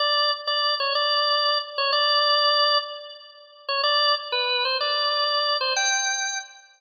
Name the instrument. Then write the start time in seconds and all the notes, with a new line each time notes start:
drawbar organ
0.00 D5
0.47 D5
0.80 C#5
0.95 D5
1.78 C#5
1.93 D5
3.69 C#5
3.83 D5
4.32 B4
4.65 C5
4.81 D5
5.61 C5
5.76 G5